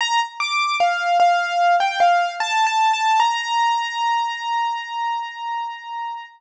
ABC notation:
X:1
M:4/4
L:1/16
Q:1/4=75
K:Bb
V:1 name="Acoustic Grand Piano"
b z d'2 f2 f3 g f2 (3a2 a2 a2 | b16 |]